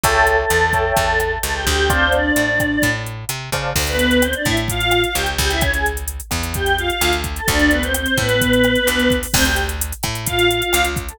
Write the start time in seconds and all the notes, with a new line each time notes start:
0.03 C#2 A4 C#5 E5 G5 A5, kick, closed hi-hat
0.27 A4 A5, closed hi-hat
0.38 A4 A5
0.50 E2, cross-stick, closed hi-hat
0.73 C#5 E5 G5 A5, kick, closed hi-hat
0.97 E2 A4 A5, kick, closed hi-hat
1.20 A4 A5, cross-stick, closed hi-hat
1.43 C#2 A4 A5, closed hi-hat
1.55 G4 G5
1.66 D2 G4 G5, kick, closed hi-hat
1.90 C4 C5 D5 F5 A5, kick, cross-stick, closed hi-hat
2.12 D4 D5, closed hi-hat
2.36 A2, closed hi-hat
2.60 kick, cross-stick, closed hi-hat
2.82 A2, kick, closed hi-hat
3.06 closed hi-hat
3.29 C3, cross-stick, closed hi-hat
3.52 C#3 C5 D5 F5 A5, kick, closed hi-hat
3.75 D2, kick, crash
3.87 B3 B4, closed hi-hat
3.99 closed hi-hat
4.11 closed hi-hat
4.22 C4 C5, cross-stick, closed hi-hat
4.33 D4 D5, closed hi-hat
4.45 A2 E4 E5, kick, closed hi-hat
4.57 closed hi-hat
4.68 F4 F5, kick, closed hi-hat
4.81 closed hi-hat
4.91 cross-stick, closed hi-hat
5.04 F4 F5, closed hi-hat
5.15 C#2 G4 G5, closed hi-hat
5.26 closed hi-hat
5.38 C#2 G4 G5, kick, closed hi-hat
5.50 E4 E5, closed hi-hat
5.61 C#4 C#5, kick, cross-stick, closed hi-hat
5.74 G#4 G#5, closed hi-hat
5.86 closed hi-hat
5.97 closed hi-hat
6.08 closed hi-hat
6.20 closed hi-hat
6.31 E2, kick, cross-stick, closed hi-hat
6.43 closed hi-hat
6.54 G4 G5, kick, closed hi-hat
6.66 closed hi-hat
6.78 F4 F5, closed hi-hat
6.89 F4 F5, closed hi-hat
7.01 D2, cross-stick, closed hi-hat
7.13 closed hi-hat
7.24 kick, closed hi-hat
7.36 A4 A5, closed hi-hat
7.48 D2 D4 D5, kick, closed hi-hat
7.59 closed hi-hat
7.71 B3 B4, closed hi-hat
7.82 C4 C5, closed hi-hat
7.94 C4 C5, cross-stick, closed hi-hat
8.06 closed hi-hat
8.17 A2 B3 B4, kick, closed hi-hat
8.29 closed hi-hat
8.41 kick, closed hi-hat
8.53 closed hi-hat
8.64 cross-stick, closed hi-hat
8.75 closed hi-hat
8.87 D2, closed hi-hat
9.00 closed hi-hat
9.10 kick, closed hi-hat
9.23 open hi-hat
9.34 D2 C4 C5, kick, cross-stick, crash
9.45 G4 G5, closed hi-hat
9.56 closed hi-hat
9.69 closed hi-hat
9.81 closed hi-hat
9.92 closed hi-hat
10.03 A2, kick, cross-stick, closed hi-hat
10.15 closed hi-hat
10.26 F4 F5, kick, closed hi-hat
10.39 closed hi-hat
10.50 F4 F5, closed hi-hat
10.62 F4 F5, closed hi-hat
10.73 C#2, cross-stick, closed hi-hat
10.85 closed hi-hat
10.96 kick, closed hi-hat
11.08 A4 A5, closed hi-hat